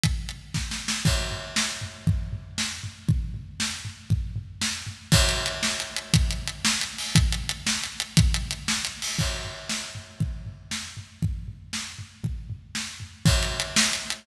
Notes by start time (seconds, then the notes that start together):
0.04 kick, closed hi-hat
0.29 closed hi-hat
0.54 kick, snare
0.71 snare
0.88 snare
1.05 kick, crash
1.31 floor tom
1.56 snare
1.81 floor tom
2.07 kick, floor tom
2.33 floor tom
2.58 snare
2.83 floor tom
3.09 kick, floor tom
3.34 floor tom
3.60 snare
3.85 floor tom
4.10 kick, floor tom
4.36 floor tom
4.62 snare
4.87 floor tom
5.12 kick, crash
5.29 closed hi-hat
5.46 closed hi-hat
5.63 snare
5.80 closed hi-hat
5.96 closed hi-hat
6.14 kick, closed hi-hat
6.31 closed hi-hat
6.48 closed hi-hat
6.65 snare
6.81 closed hi-hat
6.98 open hi-hat
7.15 kick, closed hi-hat
7.32 closed hi-hat
7.49 closed hi-hat
7.67 snare
7.84 closed hi-hat
8.00 closed hi-hat
8.17 kick, closed hi-hat
8.34 closed hi-hat
8.51 closed hi-hat
8.68 snare
8.85 closed hi-hat
9.02 open hi-hat
9.19 kick, crash
9.44 floor tom
9.69 snare
9.95 floor tom
10.20 kick, floor tom
10.46 floor tom
10.71 snare
10.97 floor tom
11.22 kick, floor tom
11.48 floor tom
11.73 snare
11.99 floor tom
12.24 kick, floor tom
12.50 floor tom
12.75 snare
13.00 floor tom
13.25 kick, crash
13.43 closed hi-hat
13.60 closed hi-hat
13.76 snare
13.93 closed hi-hat
14.10 closed hi-hat